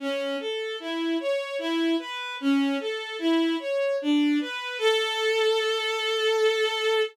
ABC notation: X:1
M:3/4
L:1/8
Q:1/4=75
K:A
V:1 name="Violin"
C A E c E B | C A E c D B | A6 |]